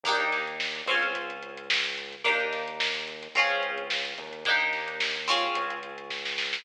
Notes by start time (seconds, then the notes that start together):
0.04 D#2 A#3 D4 D#4, kick, closed hi-hat
0.09 G4
0.20 closed hi-hat
0.32 snare, closed hi-hat
0.47 closed hi-hat
0.60 snare
0.75 closed hi-hat
0.86 C#2 C4 C#4 F4, closed hi-hat
0.91 G#4
1.03 kick, snare, closed hi-hat
1.15 kick, closed hi-hat
1.30 closed hi-hat
1.43 closed hi-hat
1.57 closed hi-hat
1.70 snare
1.85 snare, closed hi-hat
1.98 closed hi-hat
2.13 closed hi-hat
2.24 D#2 A#3 D4 D#4 G4, kick, closed hi-hat
2.40 closed hi-hat
2.53 snare, closed hi-hat
2.68 closed hi-hat
2.80 snare
2.95 closed hi-hat
3.08 closed hi-hat
3.23 snare, closed hi-hat
3.35 C#2 C4 C#4 F4, kick, closed hi-hat
3.39 G#4
3.50 closed hi-hat
3.63 closed hi-hat
3.78 closed hi-hat
3.90 snare
4.05 closed hi-hat
4.18 D#2, closed hi-hat
4.33 closed hi-hat
4.45 A#3 D4 D#4, kick, closed hi-hat
4.50 G4
4.60 snare, closed hi-hat
4.73 snare, closed hi-hat
4.88 closed hi-hat
5.00 snare
5.15 closed hi-hat
5.28 C4 C#4 F4 G#4, closed hi-hat
5.43 kick, closed hi-hat
5.55 C#2, kick, closed hi-hat
5.70 closed hi-hat
5.83 closed hi-hat
5.98 closed hi-hat
6.10 kick, snare
6.25 snare
6.38 snare
6.53 snare